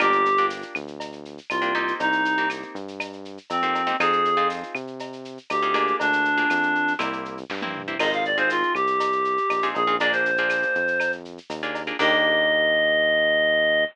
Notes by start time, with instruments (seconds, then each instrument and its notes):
0.00 synth bass 1 G1, acoustic guitar (steel) A#3 D4 F4 G4, clarinet G4, cowbell, claves, shaker
0.12 shaker
0.25 shaker
0.37 acoustic guitar (steel) A#3 D4 F4 G4, shaker
0.50 tambourine, shaker
0.62 shaker
0.75 synth bass 1 D2, claves, shaker
0.88 shaker
1.00 cowbell, shaker
1.12 shaker
1.25 shaker
1.38 shaker
1.50 synth bass 1 C2, clarinet F4, tambourine, cowbell, claves, shaker
1.62 acoustic guitar (steel) A#3 D4 F4 G4, shaker
1.75 acoustic guitar (steel) A#3 C4 D#4 G4, cowbell, shaker
1.88 shaker
2.00 synth bass 1 C2, clarinet D#4, cowbell, shaker
2.12 shaker
2.25 shaker
2.37 acoustic guitar (steel) A#3 C4 D#4 G4, shaker
2.50 tambourine, claves, shaker
2.62 shaker
2.75 synth bass 1 G2, shaker
2.88 shaker
3.00 cowbell, claves, shaker
3.13 shaker
3.25 shaker
3.38 shaker
3.50 synth bass 1 F2, clarinet C4, tambourine, cowbell, shaker
3.63 acoustic guitar (steel) A#3 C4 D#4 G4, shaker
3.75 cowbell, shaker
3.87 acoustic guitar (steel) A#3 C4 D#4 G4, shaker
3.99 synth bass 1 F2, acoustic guitar (steel) C4 D#4 F4 G#4, clarinet G#4, cowbell, claves, shaker
4.13 shaker
4.25 shaker
4.37 acoustic guitar (steel) C4 D#4 F4 G#4, shaker
4.50 tambourine, shaker
4.63 shaker
4.75 synth bass 1 C3, claves, shaker
4.87 shaker
4.99 cowbell, shaker
5.13 shaker
5.25 shaker
5.38 shaker
5.50 synth bass 1 D2, clarinet G4, tambourine, cowbell, claves, shaker
5.62 acoustic guitar (steel) C4 D#4 F4 G#4, shaker
5.74 acoustic guitar (steel) A#3 D4 F4 G#4, cowbell, shaker
5.87 shaker
6.00 synth bass 1 D2, clarinet D4, cowbell, shaker
6.13 shaker
6.25 shaker
6.37 acoustic guitar (steel) A#3 D4 F4 G#4, shaker
6.50 synth bass 1 F2, tambourine, claves, shaker
6.63 shaker
6.75 shaker
6.88 shaker
6.99 synth bass 1 C2, acoustic guitar (steel) A#3 C4 E4 G4, cowbell, claves, shaker
7.13 shaker
7.25 shaker
7.38 shaker
7.50 synth bass 1 G2, kick, snare
7.62 acoustic guitar (steel) A#3 C4 E4 G4, high tom
7.75 mid tom
7.88 acoustic guitar (steel) A#3 C4 E4 G4
7.99 synth bass 1 G#1, acoustic guitar (steel) C4 D#4 F4 G#4, clarinet D#5, crash, cowbell, claves
8.13 clarinet F5, shaker
8.25 clarinet D5, shaker
8.38 acoustic guitar (steel) C4 D#4 F4 G#4, clarinet C5, shaker
8.50 clarinet F4, tambourine, shaker
8.63 shaker
8.75 synth bass 1 C2, clarinet G4, claves, shaker
8.87 shaker
9.00 cowbell, shaker
9.12 shaker
9.25 shaker
9.38 shaker
9.50 synth bass 1 A#1, tambourine, cowbell, claves, shaker
9.62 acoustic guitar (steel) C4 D#4 F4 G#4, shaker
9.75 synth bass 1 A#1, clarinet G#4, cowbell, shaker
9.87 acoustic guitar (steel) C4 D#4 F4 G#4, shaker
10.00 acoustic guitar (steel) A#3 D4 F4 G#4, clarinet D5, cowbell, shaker
10.12 clarinet C5, shaker
10.25 shaker
10.37 acoustic guitar (steel) A#3 D4 F4 G#4, shaker
10.50 tambourine, claves, shaker
10.62 shaker
10.75 synth bass 1 F2, shaker
10.88 shaker
11.00 cowbell, claves, shaker
11.12 shaker
11.25 shaker
11.38 shaker
11.50 synth bass 1 D#2, tambourine, cowbell, shaker
11.63 acoustic guitar (steel) A#3 D4 F4 G#4, shaker
11.75 cowbell, shaker
11.87 acoustic guitar (steel) A#3 D4 F4 G#4, shaker
11.99 synth bass 1 D#2, acoustic guitar (steel) A#3 D4 D#4 G4, clarinet D#5, kick, crash